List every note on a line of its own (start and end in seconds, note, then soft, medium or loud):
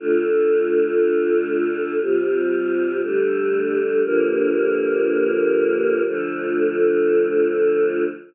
0.00 1.99 D3 medium
0.00 1.99 A3 medium
0.00 1.99 F4 medium
2.01 3.01 C3 medium
2.01 3.01 G3 medium
2.01 3.01 F4 medium
3.03 4.03 D3 medium
3.03 4.03 G3 medium
3.03 4.03 A3 medium
4.03 6.03 G2 medium
4.03 6.03 D3 medium
4.03 6.03 F3 medium
4.03 6.03 A#3 medium
6.05 8.04 D3 loud
6.05 8.04 F3 medium
6.05 8.04 A3 medium